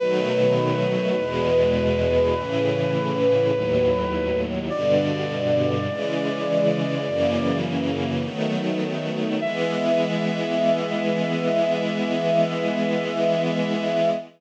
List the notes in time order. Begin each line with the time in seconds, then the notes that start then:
0.00 B2 D#3 F#3 A3 B4
1.18 E2 B2 G#3
2.35 A2 C#3 E3
3.53 D#2 A2 F#3
4.70 G2 B2 D3 D5
5.89 C#3 E3 G#3
7.07 F#2 C#3 E3 A#3
8.23 D#3 F#3 A3 B3
9.41 E3 G#3 B3 E5